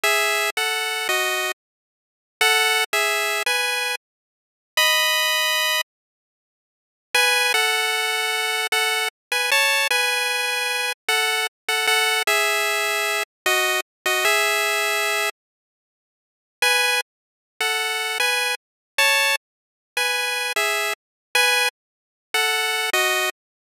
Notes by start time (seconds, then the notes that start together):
0.03 G#4 E5
0.57 A4 F#5
1.09 F#4 D#5
2.41 A4 F#5
2.93 G#4 E5
3.46 B4 G#5
4.77 D#5 B5
7.14 B4 G#5
7.54 A4 F#5
8.72 A4 F#5
9.32 B4 G#5
9.51 C#5 A5
9.91 B4 G#5
11.09 A4 F#5
11.68 A4 F#5
11.87 A4 F#5
12.27 G#4 E5
13.46 F#4 D#5
14.06 F#4 D#5
14.25 G#4 E5
16.62 B4 G#5
17.61 A4 F#5
18.20 B4 G#5
18.98 C#5 A5
19.97 B4 G#5
20.56 G#4 E5
21.35 B4 G#5
22.34 A4 F#5
22.93 F#4 D#5